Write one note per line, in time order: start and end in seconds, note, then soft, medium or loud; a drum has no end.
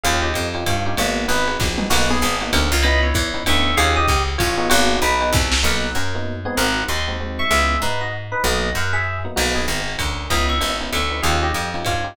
0.03 0.33 D#2 loud
0.03 0.28 C#4 loud
0.03 0.28 D#4 loud
0.03 0.28 F4 loud
0.03 0.28 G4 loud
0.03 0.20 G#4 loud
0.03 0.20 F5 loud
0.03 ride medium
0.22 0.48 G4 medium
0.22 0.48 D#5 medium
0.34 0.64 F2 medium
0.34 hi-hat pedal medium
0.34 ride medium
0.54 0.74 C#4 medium
0.54 0.74 D#4 medium
0.54 0.74 F4 medium
0.54 0.74 G4 medium
0.54 ride medium
0.66 0.95 G2 medium
0.66 0.96 F4 medium
0.66 0.96 C#5 medium
0.66 kick medium
0.66 ride loud
0.86 0.95 C#4 medium
0.86 0.95 D#4 medium
0.86 0.95 F4 medium
0.86 0.95 G4 loud
0.97 1.27 G#1 medium
0.97 1.24 A#3 medium
0.97 1.22 B3 loud
0.97 1.22 D#4 loud
0.97 1.24 F#4 loud
0.97 1.22 F#4 loud
0.97 1.22 G#4 loud
0.97 ride loud
1.28 1.57 G#1 medium
1.28 1.43 B3 medium
1.28 1.57 D#4 medium
1.28 1.43 D#4 medium
1.28 1.43 F#4 medium
1.28 1.43 G#4 medium
1.28 1.57 B4 medium
1.28 hi-hat pedal medium
1.28 ride medium
1.48 1.68 B3 medium
1.48 1.68 D#4 medium
1.48 1.68 F#4 medium
1.48 1.68 G#4 medium
1.48 ride medium
1.60 1.88 A#1 medium
1.60 kick medium
1.60 snare medium
1.78 1.86 B3 medium
1.78 1.86 D#4 loud
1.78 1.86 F#4 medium
1.78 1.86 G#4 medium
1.78 mid tom medium
1.90 2.19 B1 loud
1.90 2.06 A#3 loud
1.90 2.14 A#3 loud
1.90 2.14 B3 loud
1.90 2.14 D#4 loud
1.90 2.06 F#4 loud
1.90 2.14 F#4 loud
1.90 crash loud
1.90 ride loud
2.10 2.36 B3 loud
2.10 2.36 G#4 loud
2.21 2.51 G#1 medium
2.21 hi-hat pedal medium
2.21 ride medium
2.41 2.61 A#3 loud
2.41 2.61 B3 medium
2.41 2.61 D#4 medium
2.41 2.61 F#4 loud
2.41 ride medium
2.53 2.71 D2 medium
2.53 2.81 C#4 medium
2.53 2.81 A#4 loud
2.53 ride loud
2.72 3.13 C#2 loud
2.83 3.08 B3 loud
2.83 3.08 C#4 loud
2.83 3.08 D#4 loud
2.83 3.08 E4 loud
2.83 3.00 D#5 loud
2.83 3.00 B5 loud
2.83 ride loud
3.03 3.29 E4 loud
3.03 3.29 C#5 loud
3.14 3.44 E2 medium
3.14 kick medium
3.14 hi-hat pedal medium
3.14 ride medium
3.34 3.43 B3 medium
3.34 3.43 C#4 medium
3.34 3.43 D#4 medium
3.34 3.43 E4 medium
3.34 ride medium
3.46 3.75 D2 medium
3.46 3.70 B3 medium
3.46 3.70 C#4 medium
3.46 3.70 D#4 medium
3.46 3.70 E4 medium
3.46 3.75 E5 loud
3.46 3.75 C#6 loud
3.46 ride loud
3.77 4.06 D#2 medium
3.77 4.01 C#4 loud
3.77 4.01 D#4 loud
3.77 4.01 F4 loud
3.77 4.01 G4 loud
3.77 3.93 G#4 loud
3.77 3.93 F5 loud
3.77 ride loud
3.96 4.22 G4 loud
3.96 4.22 D#5 loud
4.08 4.37 C#2 medium
4.08 kick medium
4.08 hi-hat pedal medium
4.08 ride medium
4.28 ride medium
4.38 4.69 A1 medium
4.38 4.67 F4 loud
4.38 4.67 C#5 loud
4.38 kick medium
4.38 ride loud
4.57 4.93 B3 loud
4.57 4.93 D#4 loud
4.57 4.93 F#4 loud
4.57 4.93 G#4 loud
4.69 4.99 G#1 loud
4.69 4.96 A#3 loud
4.69 4.96 F#4 loud
4.69 ride loud
5.02 5.30 B1 medium
5.02 5.31 D#4 loud
5.02 5.31 B4 loud
5.02 hi-hat pedal medium
5.02 ride medium
5.21 5.41 B3 medium
5.21 5.41 D#4 medium
5.21 5.41 F#4 loud
5.21 5.41 G#4 medium
5.21 ride medium
5.33 5.61 C2 medium
5.33 kick medium
5.33 snare medium
5.52 snare loud
5.63 5.90 B1 medium
5.63 5.87 A#3 medium
5.63 5.87 B3 medium
5.63 5.87 D#4 loud
5.63 5.87 F#4 medium
5.63 5.93 A#4 loud
5.63 5.93 F#5 loud
5.95 6.47 F#2 medium
5.95 6.14 C#4 medium
5.95 6.14 A#4 loud
6.15 6.35 A#3 medium
6.15 6.35 B3 medium
6.15 6.35 D#4 medium
6.15 6.35 F#4 medium
6.45 6.81 G#3 medium
6.45 6.57 B3 medium
6.45 6.81 C4 medium
6.45 6.81 D#4 medium
6.45 6.81 F#4 medium
6.45 6.57 G#4 medium
6.57 6.84 G#1 medium
6.57 6.84 A#4 loud
6.57 6.84 F#5 loud
6.88 7.41 D#2 medium
6.88 7.06 D#5 medium
6.88 7.06 C6 loud
7.08 7.16 G#3 medium
7.08 7.16 C4 medium
7.08 7.16 D#4 medium
7.08 7.16 F#4 medium
7.20 7.44 G#3 medium
7.20 7.44 C4 medium
7.20 7.44 D#4 medium
7.20 7.44 F#4 medium
7.39 7.50 E5 medium
7.39 7.50 C#6 medium
7.50 7.77 C#2 medium
7.50 7.75 G#3 medium
7.50 7.75 B3 medium
7.50 7.75 C#4 loud
7.50 7.75 E4 medium
7.50 7.79 G#4 loud
7.50 7.79 E5 loud
7.82 8.34 G#2 medium
7.82 8.01 D#4 medium
7.82 8.01 B4 loud
8.01 8.12 F#4 medium
8.01 8.12 D#5 medium
8.32 8.42 D#4 medium
8.32 8.42 B4 medium
8.44 8.70 B1 medium
8.44 8.68 F#3 medium
8.44 8.68 A#3 medium
8.44 8.68 B3 medium
8.44 8.68 D#4 medium
8.44 8.71 F#4 medium
8.44 8.71 D#5 loud
8.75 9.27 F#2 medium
8.75 8.94 A#4 medium
8.75 8.94 F#5 loud
8.93 9.18 G#4 medium
8.93 9.18 E5 loud
9.25 9.33 F#3 medium
9.25 9.33 A#3 medium
9.25 9.33 B3 medium
9.25 9.33 D#4 medium
9.36 9.66 B1 medium
9.36 9.51 A#3 medium
9.36 9.60 A#3 medium
9.36 9.60 B3 medium
9.36 9.60 D#4 loud
9.36 9.51 F#4 loud
9.36 9.60 F#4 medium
9.36 crash loud
9.36 ride medium
9.55 9.80 B3 medium
9.55 9.80 G#4 loud
9.68 9.96 G#1 medium
9.68 hi-hat pedal medium
9.68 ride medium
9.88 ride medium
9.98 10.28 D2 medium
9.98 10.26 C#4 medium
9.98 10.26 A#4 medium
9.98 kick medium
9.98 ride loud
10.30 10.59 C#2 medium
10.30 10.55 B3 loud
10.30 10.55 C#4 loud
10.30 10.55 D#4 loud
10.30 10.55 E4 loud
10.30 10.47 D#5 medium
10.30 10.47 B5 loud
10.30 kick medium
10.30 ride loud
10.49 10.75 E5 medium
10.49 10.75 C#6 medium
10.61 10.90 G#1 medium
10.61 10.74 B3 medium
10.61 10.74 C#4 medium
10.61 10.74 D#4 loud
10.61 10.74 E4 medium
10.61 hi-hat pedal medium
10.61 ride medium
10.80 11.00 B3 medium
10.80 11.00 C#4 medium
10.80 11.00 D#4 medium
10.80 11.00 E4 medium
10.80 ride medium
10.92 11.21 D2 medium
10.92 11.20 E5 medium
10.92 11.20 C#6 medium
10.92 ride medium
11.11 11.19 B3 medium
11.11 11.19 C#4 medium
11.11 11.19 D#4 medium
11.11 11.19 E4 medium
11.22 11.52 D#2 medium
11.22 11.48 C#4 loud
11.22 11.48 D#4 loud
11.22 11.48 F4 loud
11.22 11.48 G4 medium
11.22 11.39 G#4 medium
11.22 11.39 F5 loud
11.22 ride medium
11.43 11.69 G4 medium
11.43 11.69 D#5 medium
11.54 11.83 F2 medium
11.54 hi-hat pedal medium
11.54 ride medium
11.74 11.94 C#4 medium
11.74 11.94 D#4 medium
11.74 11.94 F4 medium
11.74 11.94 G4 medium
11.74 ride medium
11.85 12.14 G2 medium
11.85 12.14 F4 medium
11.85 12.14 C#5 medium
11.85 kick medium
11.85 ride medium
12.04 12.13 C#4 medium
12.04 12.13 D#4 medium
12.04 12.13 F4 medium
12.04 12.13 G4 medium